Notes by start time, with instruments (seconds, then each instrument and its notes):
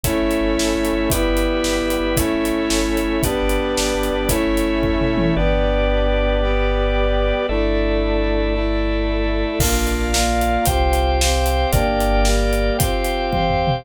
0.03 synth bass 2 G1, brass section A3 C#4 E4, drawbar organ A4 C#5 E5, kick, closed hi-hat
0.23 synth bass 2 G1
0.31 closed hi-hat
0.41 synth bass 2 G1
0.58 synth bass 2 G1, snare
0.75 synth bass 2 G1
0.85 closed hi-hat
0.93 synth bass 2 G1
1.10 synth bass 2 G1, brass section G3 B3 E4, drawbar organ G4 B4 E5, kick, closed hi-hat
1.29 synth bass 2 G1
1.37 closed hi-hat
1.45 synth bass 2 G1
1.64 synth bass 2 G1, snare
1.82 synth bass 2 G1
1.90 closed hi-hat
2.00 synth bass 2 G1
2.17 synth bass 2 G1, brass section A3 C#4 E4, drawbar organ A4 C#5 E5, kick, closed hi-hat
2.37 synth bass 2 G1
2.45 closed hi-hat
2.52 synth bass 2 G1
2.70 synth bass 2 G1, snare
2.89 synth bass 2 G1
2.97 closed hi-hat
3.04 synth bass 2 G1
3.23 synth bass 2 G1, brass section G3 B3 D4, drawbar organ G4 B4 D5, kick, closed hi-hat
3.42 synth bass 2 G1
3.49 closed hi-hat
3.60 synth bass 2 G1
3.77 synth bass 2 G1, snare
3.95 synth bass 2 G1
4.03 closed hi-hat
4.11 synth bass 2 G1
4.29 synth bass 2 G1, brass section A3 C#4 E4, drawbar organ A4 C#5 E5, kick, closed hi-hat
4.47 synth bass 2 G1
4.57 closed hi-hat
4.65 synth bass 2 G1
4.82 synth bass 2 G1, kick, floor tom
5.01 synth bass 2 G1, mid tom
5.17 synth bass 2 G1, high tom
5.36 synth bass 2 G1, brass section B3 D4 G4, drawbar organ G4 B4 D5
6.42 brass section G3 B3 G4
7.49 synth bass 2 G1, brass section A3 D4 E4, drawbar organ A4 D5 E5
8.54 brass section A3 E4 A4
9.59 synth bass 2 A#1, brass section A#3 D4 F4, drawbar organ A#4 D5 F5, kick, crash
9.87 closed hi-hat
10.13 brass section A#3 F4 A#4, snare
10.41 closed hi-hat
10.65 synth bass 2 C2, brass section C4 F4 G4, drawbar organ C5 F5 G5, kick, closed hi-hat
10.93 closed hi-hat
11.20 brass section C4 G4 C5, snare
11.46 closed hi-hat
11.72 synth bass 2 G1, brass section A#3 D4 G4, drawbar organ A#4 D5 G5, kick, closed hi-hat
12.00 closed hi-hat
12.25 brass section G3 A#3 G4, snare
12.53 closed hi-hat
12.79 brass section C4 F4 G4, drawbar organ C5 F5 G5, kick, closed hi-hat
13.04 closed hi-hat
13.32 brass section C4 G4 C5, kick, high tom
13.50 floor tom
13.67 mid tom